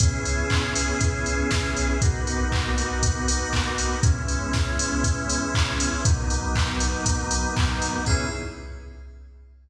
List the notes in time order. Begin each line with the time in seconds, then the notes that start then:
0.00 C#2 B3 C#4 E4 G#4, kick, closed hi-hat
0.25 open hi-hat
0.50 kick, clap
0.76 open hi-hat
1.01 kick, closed hi-hat
1.26 open hi-hat
1.51 kick, snare
1.76 B1, open hi-hat
2.02 A#3 B3 D#4 F#4, kick, closed hi-hat
2.27 open hi-hat
2.52 kick, clap
2.78 open hi-hat
3.03 kick, closed hi-hat
3.28 open hi-hat
3.53 kick, clap
3.78 open hi-hat
4.03 C#2 G#3 B3 C#4 E4, kick, closed hi-hat
4.28 open hi-hat
4.53 kick, snare
4.79 open hi-hat
5.04 kick, closed hi-hat
5.29 open hi-hat
5.54 kick, clap
5.80 open hi-hat
6.05 B1 F#3 A#3 B3 D#4, kick, closed hi-hat
6.30 open hi-hat
6.55 kick, clap
6.80 open hi-hat
7.06 kick, closed hi-hat
7.31 open hi-hat
7.57 kick, clap
7.82 open hi-hat
8.06 C#2 B3 C#4 E4 G#4, kick, crash